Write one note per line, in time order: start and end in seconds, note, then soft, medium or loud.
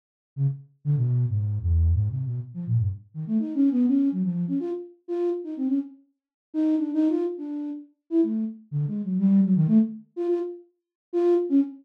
0.36 0.47 C#3 medium
0.85 0.96 D3 loud
0.97 1.26 B2 medium
1.29 1.58 G#2 medium
1.62 1.91 E2 loud
1.94 2.09 G#2 medium
2.10 2.24 C3 medium
2.26 2.40 B2 medium
2.54 2.65 F3 medium
2.67 2.78 A#2 medium
2.79 2.90 G2 medium
3.14 3.25 D#3 medium
3.27 3.38 A3 medium
3.39 3.53 D#4 medium
3.55 3.69 C#4 medium
3.71 3.86 B3 loud
3.87 4.09 C#4 medium
4.12 4.23 F#3 medium
4.23 4.45 F3 medium
4.48 4.59 C#4 medium
4.60 4.71 F4 medium
5.08 5.30 F4 medium
5.44 5.55 D#4 medium
5.57 5.68 C4 medium
5.68 5.79 C#4 medium
6.54 6.76 D#4 loud
6.77 6.91 D4 medium
6.94 7.08 D#4 loud
7.09 7.24 F4 medium
7.38 7.70 D4 soft
8.10 8.21 E4 medium
8.23 8.45 A3 soft
8.71 8.86 D3 medium
8.87 9.02 G#3 medium
9.03 9.18 F#3 medium
9.19 9.41 G3 loud
9.44 9.55 F#3 medium
9.56 9.67 D#3 loud
9.67 9.78 A3 loud
10.16 10.27 F4 medium
10.28 10.39 F4 medium
11.13 11.35 F4 loud
11.49 11.60 C#4 loud